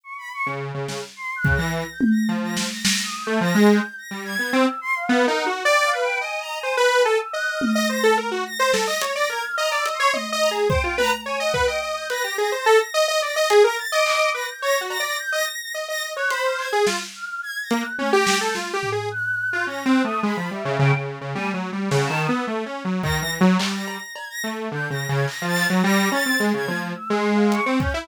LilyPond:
<<
  \new Staff \with { instrumentName = "Lead 2 (sawtooth)" } { \time 2/4 \tempo 4 = 107 r8. des8 des16 des16 r16 | r8 des16 e8 r8. | f8. r4 a16 | f16 aes8 r8 g8 b16 |
c'16 r8. \tuplet 3/2 { b8 ees'8 ges'8 } | d''8 b'8 ees''8. c''16 | b'8 a'16 r16 ees''8. ees''16 | c''16 a'16 bes'16 ges'16 r16 c''16 a'16 ees''16 |
des''16 d''16 bes'16 r16 ees''16 d''16 ees''16 des''16 | \tuplet 3/2 { ees''8 ees''8 aes'8 } c''16 f'16 b'16 r16 | des''16 ees''16 b'16 ees''16 ees''8 b'16 g'16 | aes'16 c''16 a'16 r16 ees''16 ees''16 d''16 ees''16 |
aes'16 bes'16 r16 ees''8. b'16 r16 | \tuplet 3/2 { des''8 ges'8 d''8 } r16 ees''16 r8 | ees''16 ees''8 des''16 c''8. aes'16 | f'16 r4 r16 bes16 r16 |
des'16 g'8 a'16 \tuplet 3/2 { f'8 g'8 aes'8 } | r8. f'16 \tuplet 3/2 { des'8 c'8 a8 } | aes16 f16 g16 des16 des16 des8 des16 | \tuplet 3/2 { g8 ges8 g8 des8 ees8 b8 } |
\tuplet 3/2 { a8 des'8 ges8 ees8 e8 ges8 } | g8. r8. a8 | \tuplet 3/2 { d8 des8 des8 } r16 f8 ges16 | g8 des'16 c'16 aes16 des16 f8 |
r16 aes4 c'16 des'16 e'16 | }
  \new Staff \with { instrumentName = "Choir Aahs" } { \time 2/4 des'''16 b''16 des'''16 r4 r16 | \tuplet 3/2 { c'''8 ges'''8 bes'''8 bes'''8 g'''8 bes'''8 } | r16 bes'''16 r16 bes'''16 \tuplet 3/2 { bes'''8 ees'''8 g'''8 } | bes'''8 g'''8 bes'''8 aes'''8 |
e'''8 c'''16 f''8 bes'16 ges''16 r16 | \tuplet 3/2 { g''8 f''8 g''8 aes''8 bes''8 aes''8 } | \tuplet 3/2 { b''8 aes''8 e'''8 ges'''8 f'''8 bes'''8 } | bes'''16 r8. \tuplet 3/2 { bes'''8 bes'''8 bes'''8 } |
r16 bes'''16 aes'''16 f'''16 \tuplet 3/2 { bes''8 e'''8 c'''8 } | r8 bes''16 r16 g''8 bes''16 r16 | \tuplet 3/2 { aes''8 ges''8 g''8 } ees'''16 g'''16 bes'''8 | \tuplet 3/2 { bes'''8 bes'''8 bes'''8 } r8 bes'''8 |
r16 bes'''16 a'''16 d'''8. bes'''16 g'''16 | bes'''16 r16 bes'''16 bes'''16 g'''16 bes'''16 bes'''16 bes'''16 | r16 bes'''16 r16 ges'''16 b''16 f'''16 aes'''16 r16 | r8 f'''8 \tuplet 3/2 { aes'''8 bes'''8 ges'''8 } |
\tuplet 3/2 { aes'''8 bes'''8 g'''8 } r4 | ges'''4 \tuplet 3/2 { bes'''8 ges'''8 ees'''8 } | b''8 e''8 g''16 r8. | aes''16 r8. ges''16 a''16 ees'''16 e'''16 |
r4 bes'''16 bes'''16 r8 | r16 bes'''8. aes'''16 bes'''16 r8 | \tuplet 3/2 { g'''8 bes'''8 aes'''8 bes'''8 a'''8 bes'''8 } | bes'''8 a'''8 r16 aes'''8 r16 |
\tuplet 3/2 { e'''8 c'''8 f''8 } des'''16 r16 g'''16 r16 | }
  \new DrumStaff \with { instrumentName = "Drums" } \drummode { \time 2/4 r4 r8 sn8 | r8 bd8 r8 tommh8 | r8 sn8 sn4 | r4 r4 |
r4 r4 | r4 r4 | r4 r8 tommh8 | r4 r8 sn8 |
hh4 r8 hh8 | tommh4 bd8 tommh8 | r8 bd8 r8 hh8 | cb4 r4 |
hh4 hc4 | r8 cb8 r4 | r4 hh8 hc8 | sn4 r8 hh8 |
tommh8 sn8 sn8 tomfh8 | r4 r4 | r4 r4 | tommh4 sn4 |
r4 bd4 | hc8 cb8 cb4 | r4 hc8 hc8 | r8 cb8 r8 tommh8 |
r4 hh8 bd8 | }
>>